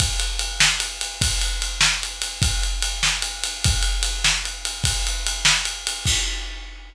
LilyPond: \new DrumStaff \drummode { \time 6/8 \tempo 4. = 99 <bd cymr>8 cymr8 cymr8 sn8 cymr8 cymr8 | <bd cymr>8 cymr8 cymr8 sn8 cymr8 cymr8 | <bd cymr>8 cymr8 cymr8 sn8 cymr8 cymr8 | <bd cymr>8 cymr8 cymr8 sn8 cymr8 cymr8 |
<bd cymr>8 cymr8 cymr8 sn8 cymr8 cymr8 | <cymc bd>4. r4. | }